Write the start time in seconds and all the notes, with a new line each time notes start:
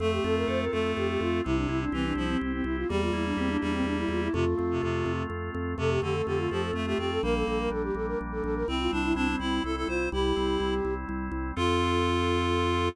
0.00 F2 A3 C4 A4
0.12 G4
0.24 F2 F4 A4
0.36 A#4
0.48 F2 A4 C5
0.60 A#4
0.72 F2 A3 F4 A4
0.96 F2 C4 G4
1.09 G4
1.20 F2 F4
1.44 C2 C3 C4 E4
1.56 D4
1.69 C2 E4
1.81 D4
1.92 C2 E3 C4 G4
2.05 D4
2.15 C2 F3 E4
2.29 C4
2.41 C2 C4
2.53 C4
2.64 C2 E4
2.77 F4
2.89 E2 G3 A#3 G4
3.01 F4
3.12 E2 E4
3.25 D4
3.37 E2 C4 G4
3.49 D4
3.61 E2 G3 D4 E4
3.73 C4
3.84 E2 A#3 D4
3.98 E4
4.08 E2 E4 F4
4.22 E4
4.33 F2 C3 A3 F4
4.58 F2 C4
4.71 C3
4.82 F2 C3 F4
5.06 F2 C4
5.30 F2 A3
5.54 F2 C4
5.78 F2 C3 A3 A4
5.90 G4
6.02 F2 D3 C4 G4
6.15 A4
6.26 F2 D3 F4 G4
6.39 F4
6.50 F2 F3 C4 G4
6.62 A4
6.73 F2 A3
6.86 A3 G4
6.98 F2 C4 G4
7.11 A4
7.23 A#1 G3 A#3 A#4
7.35 A4
7.47 A#1 A#3 A4
7.59 A#4
7.70 A#1 D4 A4
7.83 G4
7.95 A#1 A#3 A4
8.07 A#4
8.19 A#1 G3
8.32 A4
8.43 A#1 A#3 A4
8.55 A#4
8.67 C2 G3 C4 E4
8.79 F4
8.91 C2 C4 D4 E4
9.04 E4
9.15 C2 C4 D4 E4
9.28 C4
9.39 C2 C4 E4
9.64 C2 G3 E4 A4
9.76 E4 A4
9.88 C2 C4 F4 C5
10.12 C2 G3 E4 G4
10.36 C2 C4
10.60 C2 E4
10.85 C2 C4
11.09 C2 G3
11.32 C2 C4
11.56 F2 C4 F4 A4